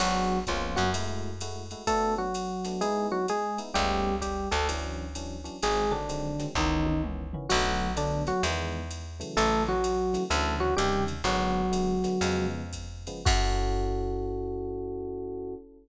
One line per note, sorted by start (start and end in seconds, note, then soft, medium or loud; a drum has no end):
0.00 0.45 G#1 medium
0.00 0.39 F#3 loud
0.00 0.36 B3 medium
0.00 0.36 D4 medium
0.00 0.36 F#4 loud
0.00 0.39 F#4 loud
0.00 0.36 G#4 loud
0.00 crash medium
0.00 ride medium
0.47 0.77 C#2 medium
0.47 0.77 F3 medium
0.47 0.84 A#3 medium
0.47 0.84 B3 medium
0.47 0.84 C#4 medium
0.47 0.84 F4 medium
0.47 0.77 F4 medium
0.47 kick medium
0.47 hi-hat pedal medium
0.47 ride medium
0.76 1.75 F#2 medium
0.76 0.90 F#3 medium
0.76 0.90 F#4 loud
0.76 snare soft
0.76 ride medium
0.94 1.30 G#3 loud
0.94 1.30 A3 medium
0.94 1.30 E4 medium
0.94 1.30 F#4 medium
0.94 ride medium
1.41 1.62 G#3 medium
1.41 1.62 A3 medium
1.41 1.62 E4 medium
1.41 1.62 F#4 medium
1.41 hi-hat pedal medium
1.41 ride medium
1.71 1.83 G#3 medium
1.71 1.83 A3 medium
1.71 1.83 E4 medium
1.71 1.83 F#4 medium
1.71 ride medium
1.87 2.14 A3 loud
1.87 2.25 A3 loud
1.87 2.25 B3 medium
1.87 2.25 D4 medium
1.87 2.25 F#4 medium
1.87 2.14 A4 loud
1.87 kick medium
1.87 ride medium
2.18 2.81 F#3 medium
2.18 2.81 F#4 medium
2.34 hi-hat pedal medium
2.34 ride medium
2.64 2.77 A3 medium
2.64 2.77 B3 medium
2.64 2.77 D4 medium
2.64 2.77 F#4 medium
2.64 snare soft
2.64 ride medium
2.81 3.18 G#3 medium
2.81 3.07 G#3 medium
2.81 3.18 B3 loud
2.81 3.18 D#4 medium
2.81 3.18 E4 loud
2.81 3.07 G#4 loud
2.81 ride medium
3.12 3.26 F#3 medium
3.12 3.26 F#4 loud
3.28 3.59 G#3 medium
3.28 3.59 G#4 loud
3.28 hi-hat pedal medium
3.28 ride medium
3.58 3.70 G#3 medium
3.58 3.70 B3 medium
3.58 3.70 D#4 medium
3.58 3.70 E4 medium
3.58 ride medium
3.74 4.48 C#2 loud
3.74 4.11 G3 medium
3.74 4.15 G3 loud
3.74 4.11 A3 medium
3.74 4.11 B3 loud
3.74 4.11 C#4 medium
3.74 4.15 G4 loud
3.74 kick soft
3.74 ride medium
4.21 4.49 G3 medium
4.21 4.49 G4 medium
4.21 kick soft
4.21 hi-hat pedal medium
4.21 ride medium
4.51 5.49 D2 loud
4.51 4.67 A3 medium
4.51 4.67 A4 medium
4.51 snare soft
4.51 ride medium
4.69 5.06 E3 loud
4.69 5.06 F#3 medium
4.69 5.06 C#4 medium
4.69 5.06 D4 medium
4.69 ride medium
5.15 5.37 E3 medium
5.15 5.37 F#3 medium
5.15 5.37 C#4 medium
5.15 5.37 D4 medium
5.15 hi-hat pedal medium
5.15 ride medium
5.44 5.56 E3 medium
5.44 5.56 F#3 medium
5.44 5.56 C#4 medium
5.44 5.56 D4 medium
5.44 ride medium
5.62 6.44 G#1 medium
5.62 5.85 D#3 medium
5.62 5.85 F#3 medium
5.62 5.92 G#3 loud
5.62 5.85 G#3 medium
5.62 5.85 C4 medium
5.62 5.92 G#4 loud
5.62 ride medium
5.91 6.46 D3 medium
5.91 6.03 D#3 medium
5.91 6.03 F#3 medium
5.91 6.03 G#3 medium
5.91 6.03 C4 medium
5.91 6.46 D4 loud
6.09 6.30 D#3 medium
6.09 6.30 F#3 medium
6.09 6.30 G#3 medium
6.09 6.30 C4 medium
6.09 hi-hat pedal medium
6.09 ride medium
6.39 6.51 D#3 medium
6.39 6.51 F#3 medium
6.39 6.51 G#3 medium
6.39 6.51 C4 medium
6.39 snare soft
6.39 ride medium
6.55 7.36 C#2 loud
6.55 6.94 D#3 loud
6.55 7.01 D#3 medium
6.55 6.94 E3 medium
6.55 6.94 B3 loud
6.55 6.94 C#4 medium
6.55 7.01 D#4 medium
6.55 kick medium
6.55 snare medium
6.86 high tom medium
7.03 7.25 D#3 medium
7.03 7.25 E3 medium
7.03 7.25 B3 medium
7.03 7.25 C#4 medium
7.03 mid tom medium
7.33 7.46 D#3 medium
7.33 7.46 E3 medium
7.33 7.46 B3 medium
7.33 7.46 C#4 medium
7.33 floor tom medium
7.49 8.32 B1 loud
7.49 7.88 D3 loud
7.49 7.92 F#3 loud
7.49 7.88 F#3 loud
7.49 7.88 A3 loud
7.49 7.88 B3 medium
7.49 7.92 F#4 loud
7.49 crash medium
7.49 ride medium
7.96 8.33 D3 medium
7.96 8.23 D3 loud
7.96 8.33 F#3 medium
7.96 8.33 A3 medium
7.96 8.33 B3 medium
7.96 8.23 D4 loud
7.96 hi-hat pedal medium
7.96 ride medium
8.27 8.42 F#3 medium
8.27 8.42 F#4 loud
8.27 snare soft
8.27 ride medium
8.43 9.24 E2 loud
8.43 8.81 D#3 medium
8.43 8.81 E3 loud
8.43 8.81 G#3 loud
8.43 8.81 B3 loud
8.43 ride medium
8.91 hi-hat pedal medium
8.91 ride medium
9.20 9.73 C#3 medium
9.20 9.73 E3 loud
9.20 9.73 F#3 medium
9.20 9.73 A3 loud
9.20 ride medium
9.37 10.17 A1 loud
9.37 9.63 A3 loud
9.37 9.63 A4 loud
9.37 ride medium
9.69 10.24 F#3 medium
9.69 10.24 F#4 loud
9.84 hi-hat pedal medium
9.84 ride medium
10.14 10.25 C#3 medium
10.14 10.25 E3 medium
10.14 10.25 F#3 medium
10.14 10.25 A3 medium
10.14 snare soft
10.14 ride medium
10.30 10.75 D2 loud
10.30 10.69 C#3 loud
10.30 10.69 D3 medium
10.30 10.69 E3 loud
10.30 10.69 F#3 loud
10.30 10.54 A3 medium
10.30 10.54 A4 medium
10.30 ride medium
10.60 10.74 F#3 medium
10.60 10.74 F#4 loud
10.77 11.22 D#2 medium
10.77 11.13 C3 loud
10.77 11.13 C#3 loud
10.77 11.13 D#3 loud
10.77 11.04 G3 medium
10.77 11.13 G3 loud
10.77 11.04 G4 loud
10.77 hi-hat pedal medium
10.77 ride medium
11.08 ride medium
11.24 12.07 G#1 medium
11.24 11.62 D3 loud
11.24 12.47 F#3 loud
11.24 11.62 F#3 loud
11.24 11.62 G#3 medium
11.24 11.62 B3 loud
11.24 12.47 F#4 loud
11.24 ride medium
11.72 11.94 D3 medium
11.72 11.94 F#3 medium
11.72 11.94 G#3 medium
11.72 11.94 B3 medium
11.72 hi-hat pedal medium
11.72 ride medium
12.04 12.16 D3 medium
12.04 12.16 F#3 medium
12.04 12.16 G#3 medium
12.04 12.16 B3 medium
12.04 snare soft
12.04 ride medium
12.21 13.10 F2 medium
12.21 12.62 C#3 loud
12.21 12.62 F3 loud
12.21 12.62 G#3 loud
12.21 12.62 B3 loud
12.21 ride medium
12.73 kick soft
12.73 hi-hat pedal medium
12.73 ride medium
13.07 13.21 C#3 medium
13.07 13.21 F3 loud
13.07 13.21 G#3 medium
13.07 13.21 B3 medium
13.07 ride medium
13.25 15.56 F#2 loud
13.25 15.54 C#4 medium
13.25 15.54 E4 medium
13.25 15.54 F#4 loud
13.25 15.54 F#4 medium
13.25 15.54 A4 loud
13.25 kick loud
13.25 crash loud